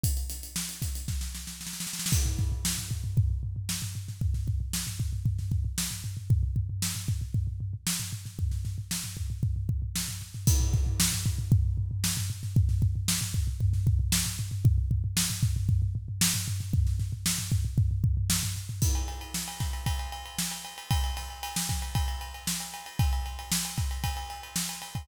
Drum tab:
CC |--------------------------------|x-------------------------------|--------------------------------|--------------------------------|
RD |--------------------------------|--------------------------------|--------------------------------|--------------------------------|
HH |x-x-x-x---x-x-x-----------------|--------------------------------|--------------------------------|--------------------------------|
SD |----o---o---o-o-o-o-o-o-oooooooo|----o---o---------------o-----o-|--o-----o---------o-----o-------|--------o---------------o-----o-|
FT |--------------------------------|--o-o-o---o-o-o-o-o-o-o---o-o-o-|o-o-o-o---o-o-o-o-o-o-o---o-o-o-|o-o-o-o---o-o-o-o-o-o-o---o-o-o-|
BD |o-----------o---o---------------|o---o-------o---o---------------|o---o-------o---o---o-----------|o---o-------o---o---------------|

CC |--------------------------------|x-------------------------------|--------------------------------|--------------------------------|
RD |--------------------------------|--------------------------------|--------------------------------|--------------------------------|
HH |--------------------------------|--------------------------------|--------------------------------|--------------------------------|
SD |--o-o---o---------------o---o-o-|----o---o---------------o-----o-|--o-----o---------o-----o-------|--------o---------------o-----o-|
FT |o-o-o-o---o-o-o-o-o-o-o---o-o-o-|--o-o-o---o-o-o-o-o-o-o---o-o-o-|o-o-o-o---o-o-o-o-o-o-o---o-o-o-|o-o-o-o---o-o-o-o-o-o-o---o-o-o-|
BD |o-----------o---o---o-----------|o---o-------o---o---------------|o---o-------o---o---o-----------|o---o-------o---o---------------|

CC |--------------------------------|x-------------------------------|--------------------------------|--------------------------------|
RD |--------------------------------|--x-x-x---x-x-x-x-x-x-x---x-x-x-|x-x-x-x-x---x-x-x-x-x-x---x-x-x-|x-x-x-x---x-x-x-x-x-x-x---x-x-x-|
HH |--------------------------------|--------------------------------|--------------------------------|--------------------------------|
SD |--o-o---o---------------o---o-o-|--------o---o-----------o-------|----o-----o-o-----------o-------|--------o---o-----------o---o---|
FT |o-o-o-o---o-o-o-o-o-o-o---o-o-o-|--------------------------------|--------------------------------|--------------------------------|
BD |o-----------o---o---o-----------|o-----------o---o---------------|o-----------o---o---------------|o-----------o---o-------------o-|